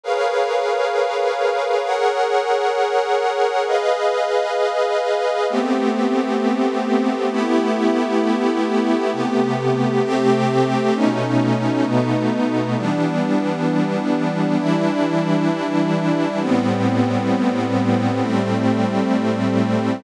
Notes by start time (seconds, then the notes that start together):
0.04 G#4 A#4 B4 C#5 F5
1.85 G#4 A#4 C#5 F#5
3.67 G#4 B4 D#5 F5
5.50 A3 B3 C4 G4
7.31 A3 B3 E4 G4
9.13 C3 A3 B3 G4
10.04 C3 A3 C4 G4
10.95 B2 A3 C#4 D#4
11.85 B2 A3 B3 D#4
12.77 E3 G3 B3 D4
14.59 E3 G3 D4 E4
16.40 A2 G3 B3 C4
18.22 A2 G3 A3 C4